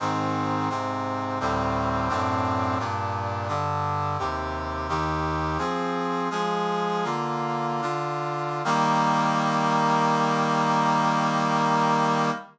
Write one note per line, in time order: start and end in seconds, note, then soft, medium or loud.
0.00 0.69 G#2 medium
0.00 0.69 D#3 medium
0.00 0.69 C4 medium
0.69 1.39 G#2 medium
0.69 1.39 C3 medium
0.69 1.39 C4 medium
1.40 2.09 D2 medium
1.40 2.08 A2 medium
1.40 2.09 G3 medium
1.40 2.08 C4 medium
2.09 2.78 F#2 medium
2.09 2.78 A2 medium
2.09 2.78 C4 medium
2.09 2.78 D4 medium
2.79 3.48 G2 medium
2.79 3.48 A#2 medium
2.79 3.48 D4 medium
3.48 4.17 G2 medium
3.48 4.17 D3 medium
3.48 4.17 D4 medium
4.19 4.88 D#2 medium
4.19 4.88 C3 medium
4.19 4.88 G4 medium
4.89 5.58 D#2 medium
4.89 5.58 D#3 medium
4.89 5.58 G4 medium
5.58 6.29 F3 medium
5.58 6.29 C4 medium
5.58 6.29 G#4 medium
6.30 7.04 F3 medium
6.30 7.04 G#3 medium
6.30 7.04 G#4 medium
7.04 7.81 D3 medium
7.04 7.81 A#3 medium
7.04 7.81 F4 medium
7.81 8.62 D3 medium
7.81 8.62 D4 medium
7.81 8.62 F4 medium
8.65 12.30 D#3 loud
8.65 12.30 G3 loud
8.65 12.30 A#3 loud